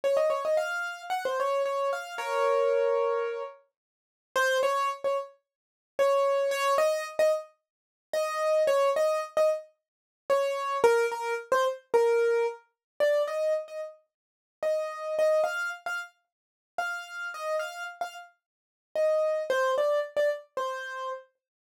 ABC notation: X:1
M:4/4
L:1/16
Q:1/4=111
K:Db
V:1 name="Acoustic Grand Piano"
d e d e f4 g c d2 d2 f2 | [Bd]10 z6 | [K:Ab] c2 d2 z d z6 d4 | d2 e2 z e z6 e4 |
d2 e2 z e z6 d4 | B2 B2 z c z2 B4 z4 | [K:Bb] d2 e2 z e z6 e4 | e2 f2 z f z6 f4 |
e2 f2 z f z6 e4 | c2 d2 z d z2 c4 z4 |]